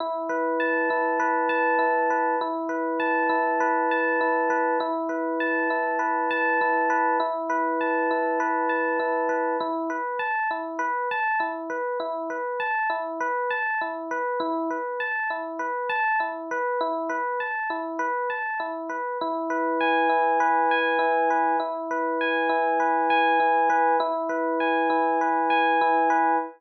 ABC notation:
X:1
M:4/4
L:1/8
Q:1/4=100
K:E
V:1 name="Electric Piano 1"
E B a E B a E B | E B a E B a E B | E B a E B a E B | E B a E B a E B |
E B a E B a E B | E B a E B a E B | E B a E B a E B | E B a E B a E B |
E B g E B g E B | E B g E B g E B | E B g E B g E B |]